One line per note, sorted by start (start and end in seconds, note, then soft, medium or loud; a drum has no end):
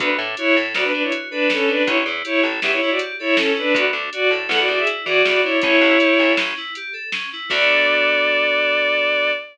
0.00 0.17 D2 medium
0.00 0.17 B3 loud
0.00 0.10 D4 medium
0.00 0.10 B4 loud
0.00 kick loud
0.00 closed hi-hat loud
0.19 0.35 A2 medium
0.19 0.36 D4 medium
0.37 0.56 E4 loud
0.37 0.54 F#4 medium
0.37 0.56 C#5 loud
0.37 closed hi-hat loud
0.56 0.74 A2 medium
0.56 0.73 A4 medium
0.75 0.92 D2 medium
0.75 0.91 B3 medium
0.75 0.84 F#4 medium
0.75 0.84 D5 medium
0.75 snare loud
0.84 0.93 D4 medium
0.84 0.93 B4 loud
0.94 1.10 D4 medium
0.94 1.03 D4 medium
0.94 1.03 B4 loud
1.03 1.12 E4 medium
1.03 1.12 C#5 medium
1.11 1.28 F#4 medium
1.11 closed hi-hat loud
1.31 1.49 D4 medium
1.31 1.48 A4 medium
1.31 1.49 B4 medium
1.50 1.67 B3 medium
1.50 1.69 C#4 medium
1.50 1.69 A4 medium
1.50 snare loud
1.68 1.84 D4 medium
1.68 1.83 D4 medium
1.68 1.83 B4 medium
1.86 2.04 A1 medium
1.86 2.03 C#4 loud
1.86 1.97 E4 loud
1.86 1.97 C#5 loud
1.86 kick loud
1.86 closed hi-hat loud
2.06 2.23 E2 medium
2.06 2.24 E4 medium
2.24 2.42 E4 medium
2.24 2.41 G4 medium
2.24 2.42 C#5 loud
2.24 closed hi-hat loud
2.43 2.60 A1 medium
2.43 2.61 A4 medium
2.62 2.80 E2 medium
2.62 2.79 C#4 medium
2.62 2.71 G4 medium
2.62 2.71 E5 medium
2.62 snare loud
2.72 2.80 E4 medium
2.72 2.80 C#5 loud
2.81 2.90 E4 loud
2.81 2.99 E4 medium
2.81 2.90 C#5 loud
2.90 2.99 F#4 medium
2.90 2.99 D5 medium
2.99 3.16 G4 medium
2.99 closed hi-hat loud
3.19 3.36 E4 medium
3.19 3.36 A4 medium
3.19 3.36 C#5 loud
3.36 3.52 C#4 medium
3.36 3.55 C#4 medium
3.36 3.52 A4 medium
3.36 snare loud
3.56 3.74 D4 medium
3.56 3.72 E4 medium
3.56 3.74 B4 loud
3.75 3.91 D2 loud
3.75 3.91 B3 loud
3.75 3.85 F#4 loud
3.75 3.85 D5 loud
3.75 kick loud
3.75 closed hi-hat loud
3.93 4.10 D2 medium
3.93 4.09 D4 medium
4.13 4.29 F#4 medium
4.13 4.31 F#4 medium
4.13 4.31 D5 medium
4.13 closed hi-hat loud
4.31 4.48 A2 medium
4.31 4.48 A4 medium
4.49 4.66 E2 loud
4.49 4.66 B3 medium
4.49 4.59 A4 loud
4.49 4.59 F#5 loud
4.49 snare loud
4.59 4.68 F#4 medium
4.59 4.68 D5 loud
4.68 4.85 E2 medium
4.68 4.86 D4 medium
4.68 4.79 F#4 medium
4.68 4.79 D5 loud
4.79 4.88 G#4 medium
4.79 4.88 E5 medium
4.87 5.04 E4 medium
4.87 closed hi-hat loud
5.05 5.23 E3 medium
5.05 5.22 F#4 medium
5.05 5.23 G#4 medium
5.05 5.22 D5 loud
5.25 5.42 E2 medium
5.25 5.43 B3 medium
5.25 5.41 F#4 medium
5.25 5.41 D5 medium
5.25 snare loud
5.42 5.62 D4 medium
5.42 5.60 E4 medium
5.42 5.60 C#5 medium
5.62 5.80 A1 loud
5.62 5.79 C#4 loud
5.62 6.32 E4 loud
5.62 6.32 C#5 loud
5.62 kick loud
5.62 closed hi-hat loud
5.81 5.98 A1 medium
5.81 5.99 E4 medium
6.00 6.17 G4 medium
6.00 closed hi-hat loud
6.19 6.36 A1 medium
6.19 6.36 A4 medium
6.37 6.54 A1 medium
6.37 6.55 C#4 medium
6.37 snare loud
6.57 6.74 E4 medium
6.75 6.93 G4 medium
6.75 closed hi-hat loud
6.93 7.10 A4 medium
7.12 7.29 C#4 medium
7.12 snare loud
7.33 7.49 E4 medium
7.49 9.33 D2 loud
7.49 9.31 B3 medium
7.49 9.31 D4 loud
7.49 9.31 F#4 loud
7.49 9.31 A4 loud
7.49 9.31 D5 loud
7.49 kick loud
7.49 crash loud